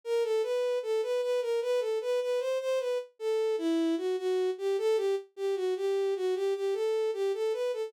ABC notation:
X:1
M:4/4
L:1/16
Q:1/4=76
K:Em
V:1 name="Violin"
^A =A B2 A B B ^A | B A B B c c B z A2 E2 F F2 G | A G z G F G2 F G G A2 G A B A |]